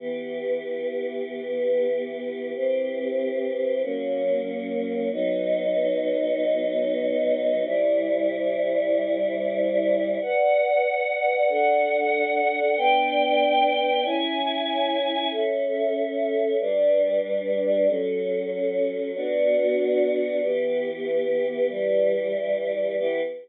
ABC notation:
X:1
M:4/4
L:1/8
Q:1/4=94
K:Em
V:1 name="Choir Aahs"
[E,B,G]8 | [E,CG]4 [F,^A,^C]4 | [F,B,^D]8 | [C,G,E]8 |
[K:Bm] [Bdf]4 [DAf]4 | [B,Dg]4 [CE^g]4 | [CAe]4 [G,DB]4 | [F,CA]4 [B,DF]4 |
[K:Em] [E,B,G]4 [E,G,G]4 | [E,B,G]2 z6 |]